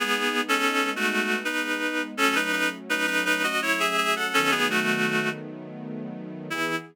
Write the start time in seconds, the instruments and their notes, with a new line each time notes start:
0.00 string ensemble 1 G#3 B3 D#4, clarinet B3 G#4
0.48 clarinet C#4 A4
0.96 clarinet A3 F#4
1.45 clarinet D#4 B4
2.17 string ensemble 1 F#3 A3 C#4, clarinet C#4 A4
2.35 clarinet D#4 B4
2.52 clarinet D#4 B4
2.89 clarinet D#4 B4
3.07 clarinet D#4 B4
3.25 clarinet D#4 B4
3.43 clarinet F#4 D#5
3.62 clarinet E4 C#5
3.79 clarinet G#4 E5
3.97 clarinet G#4 E5
4.16 clarinet A4 F#5
4.33 string ensemble 1 D#3 F#3 A3 B3, clarinet C#4 A4
4.51 clarinet B3 G#4
4.70 clarinet A3 F#4
6.50 string ensemble 1 E3 B3 G#4, clarinet E4